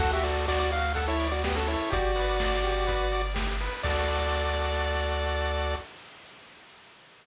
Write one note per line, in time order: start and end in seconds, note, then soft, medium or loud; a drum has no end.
0.00 1.77 D2 medium
0.00 0.22 F#4 loud
0.00 0.11 A4 medium
0.00 0.11 F#5 loud
0.00 kick loud
0.00 crash loud
0.13 0.24 G4 medium
0.13 0.24 E5 medium
0.23 0.46 F#4 medium
0.23 0.46 A4 medium
0.23 0.46 D5 medium
0.23 open hi-hat medium
0.47 0.59 F#4 medium
0.47 0.59 D5 loud
0.47 0.70 D5 medium
0.47 kick medium
0.47 clap loud
0.60 0.71 F#4 medium
0.60 0.71 D5 medium
0.71 0.93 F#4 medium
0.71 0.93 F5 medium
0.71 open hi-hat medium
0.95 1.06 A4 medium
0.95 1.18 A4 loud
0.95 1.06 F#5 medium
0.95 kick medium
0.95 closed hi-hat loud
1.08 1.28 E4 medium
1.08 1.28 C#5 medium
1.20 1.41 D5 medium
1.20 open hi-hat medium
1.31 1.43 F#4 medium
1.31 1.43 D5 medium
1.44 1.56 B3 medium
1.44 1.67 F#4 medium
1.44 1.56 G4 medium
1.44 kick medium
1.44 snare loud
1.56 1.68 C#4 medium
1.56 1.68 A4 medium
1.67 1.91 E4 medium
1.67 1.89 A4 medium
1.67 1.91 C#5 medium
1.67 open hi-hat medium
1.90 3.70 G1 loud
1.90 3.22 F#4 medium
1.90 2.12 G4 loud
1.90 3.22 D5 loud
1.90 kick loud
1.90 closed hi-hat loud
2.16 2.37 B4 medium
2.16 open hi-hat medium
2.40 2.62 D5 medium
2.40 kick medium
2.40 snare loud
2.64 2.85 G4 medium
2.64 open hi-hat medium
2.87 3.08 B4 medium
2.87 kick medium
2.87 closed hi-hat loud
3.12 3.34 D5 medium
3.12 open hi-hat medium
3.34 3.56 G4 medium
3.34 kick medium
3.34 snare loud
3.60 3.82 B4 medium
3.60 open hi-hat medium
3.83 5.75 D2 medium
3.83 5.76 F#4 medium
3.83 5.76 A4 medium
3.83 5.74 D5 loud
3.83 5.76 D5 medium
3.83 kick loud
3.83 crash loud